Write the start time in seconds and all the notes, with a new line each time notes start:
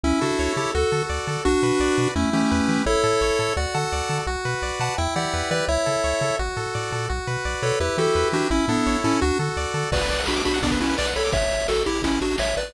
0.03 C#2 C#4 E4
0.21 C#3 D4 F#4 A4
0.39 C#2 C#5
0.57 C#3 E4 G4 A4
0.75 D2 F#4 A4
0.92 D3 A4
1.09 D2 D5
1.27 D3 A4
1.45 B1 D4 F#4
1.63 B2 B4
1.80 B1 D5
1.98 B2 B4
2.16 E2 A3 C#4 E4
2.33 E3 A3 C#4 G4
2.51 E2 B4
2.68 E3 G4
2.86 A1 E4 A4 C#5
3.04 A2 A4
3.21 A1 C#5
3.39 A2 A4
3.57 D2 F#4 D5 F#5
3.74 D3 A4 F#5 A5
3.92 D2 D5
4.09 D3 A4
4.27 B1 F#4
4.45 B2 B4
4.62 B1 D5
4.80 B2 B4 F#5 A5
4.98 E2 E4 E5 G5
5.16 E3 G4 D5 F#5
5.34 E2 B4
5.51 E3 G4 B4 D5
5.68 C#2 E4 C#5 E5
5.86 C#3 A4
6.04 C#2 C#5
6.21 C#3 A4
6.39 A1 F#4
6.57 A2 A4
6.75 A2 D5
6.92 A#2 A4
7.09 B1 F#4
7.27 B2 B4
7.45 B1 D5
7.62 B2 A4 B4 C#5
7.80 E2 E4 G4 B4
7.97 E3 F#4 G4 A4
8.15 E2 B4
8.32 E3 D4 F#4 G4
8.50 A1 C#4 E4
8.68 A2 B3 D4 A4
8.86 A1 C#5
9.04 A2 C#4 E4 A4
9.21 D2 D4 F#4
9.39 D3 A4
9.57 D2 D5
9.74 D3 A4
9.92 B1 F#4 B4 D5, kick, crash
10.00 B4, closed hi-hat
10.09 B1 D5, closed hi-hat
10.18 F#5, closed hi-hat
10.26 B1 D4 F#4 B5, snare
10.36 D6, closed hi-hat
10.44 B1 D4 F#4 B5, closed hi-hat
10.54 F#5, closed hi-hat
10.62 B1 B3 D4 D5, kick, closed hi-hat
10.71 B4, kick, closed hi-hat
10.80 B1 C#4 E4 F#4, closed hi-hat
10.89 B4, closed hi-hat
10.98 B1 B4 D5, snare
11.05 F#5, closed hi-hat
11.15 B1 A4 C#5 B5, closed hi-hat
11.25 D6, closed hi-hat
11.32 A1 C#5 E5, kick, closed hi-hat
11.42 closed hi-hat
11.51 A1, closed hi-hat
11.60 closed hi-hat
11.68 A1 F#4 A4, snare
11.76 closed hi-hat
11.86 A1 E4 G4, closed hi-hat
11.95 closed hi-hat
12.02 A1 C#4 E4, kick, closed hi-hat
12.14 closed hi-hat
12.21 A1 D4 F#4, closed hi-hat
12.31 closed hi-hat
12.38 A1 C#5 E5, snare
12.46 closed hi-hat
12.57 A1 B4 D5, closed hi-hat
12.67 closed hi-hat